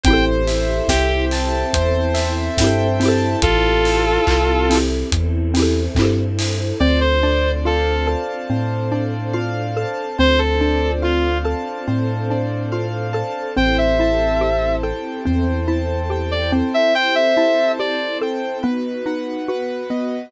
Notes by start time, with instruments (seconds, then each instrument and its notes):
0.04 synth bass 2 A1, string ensemble 1 C4 E4 G4 A4, xylophone C4, acoustic grand piano C5, distortion guitar G5, kick, closed hi-hat
0.08 xylophone E4 G4
0.13 xylophone A4
0.47 acoustic grand piano E5, open hi-hat
0.88 synth bass 2 C2, distortion guitar G4, acoustic grand piano G5, kick, snare
1.31 acoustic grand piano A5, open hi-hat
1.73 synth bass 2 E2, string ensemble 1 C4 E4 A4 C5, acoustic grand piano C5, kick, closed hi-hat
2.14 acoustic grand piano E5, open hi-hat
2.58 synth bass 2 G2, xylophone C4 E4, acoustic grand piano G5, kick, snare
2.64 xylophone G4 A4
3.00 xylophone C4 E4, acoustic grand piano A5, open hi-hat
3.05 xylophone G4 A4
3.42 synth bass 2 A1, string ensemble 1 C4 E4 G4 A4, distortion guitar F4 A4, kick, closed hi-hat
3.85 open hi-hat
4.27 synth bass 2 C2, kick, clap
4.70 xylophone C4 E4, open hi-hat
4.75 xylophone G4 A4
5.11 synth bass 2 E2, string ensemble 1 C4 E4 A4 C5, kick, closed hi-hat
5.54 xylophone C4 E4, open hi-hat
5.60 xylophone G4 A4
5.95 synth bass 2 G2, xylophone C4 E4, kick, clap
6.02 xylophone G4 A4
6.39 open hi-hat
6.80 synth bass 2 D2, xylophone C4, string ensemble 1 C4 D4 F4 A4, acoustic grand piano C5, distortion guitar D5
7.01 distortion guitar C5
7.23 xylophone D4, acoustic grand piano D5
7.65 xylophone F4, distortion guitar A4, acoustic grand piano F5
8.07 xylophone A4, acoustic grand piano A5
8.50 synth bass 2 A2, xylophone C4, string ensemble 1 C4 D4 A4 C5, acoustic grand piano C5
8.92 xylophone D4, acoustic grand piano D5
9.33 xylophone F4, acoustic grand piano F5
9.77 xylophone A4, acoustic grand piano A5
10.18 synth bass 2 D2, string ensemble 1 C4 D4 F4 A4, xylophone C4, acoustic grand piano C5, distortion guitar C5
10.39 distortion guitar A4
10.61 xylophone D4, acoustic grand piano D5
11.02 xylophone F4, distortion guitar F4, acoustic grand piano F5
11.45 xylophone A4, acoustic grand piano A5
11.87 synth bass 2 A2, xylophone C4, string ensemble 1 C4 D4 A4 C5, acoustic grand piano C5
12.30 xylophone D4, acoustic grand piano D5
12.72 xylophone F4, acoustic grand piano F5
13.13 xylophone A4, acoustic grand piano A5
13.56 synth bass 2 A1, string ensemble 1 C4 E4 G4 A4, xylophone C4, acoustic grand piano C5, distortion guitar G5
13.78 distortion guitar E5
13.99 xylophone E4, acoustic grand piano A5
14.41 xylophone G4, acoustic grand piano C5
14.83 xylophone A4, acoustic grand piano G5
15.25 synth bass 2 E2, string ensemble 1 C4 E4 A4 C5, xylophone C4, acoustic grand piano C5
15.68 xylophone E4, acoustic grand piano A5
16.10 xylophone G4, acoustic grand piano G5
16.31 distortion guitar D5
16.52 xylophone C4, acoustic grand piano C5
16.74 distortion guitar E5
16.94 string ensemble 1 C4 E4 G4 A4, acoustic grand piano C5, distortion guitar G5
17.15 distortion guitar E5
17.37 xylophone E4, acoustic grand piano A5
17.78 string ensemble 1 C4 E4 A4 C5, xylophone G4, acoustic grand piano C5, distortion guitar D5
18.21 xylophone A4, acoustic grand piano G5
18.63 xylophone B3, string ensemble 1 B3 D#4 F#4, acoustic grand piano B4
19.06 xylophone D#4, acoustic grand piano F#5
19.48 string ensemble 1 B3 F#4 B4, xylophone F#4, acoustic grand piano B4
19.90 xylophone B3, acoustic grand piano D#5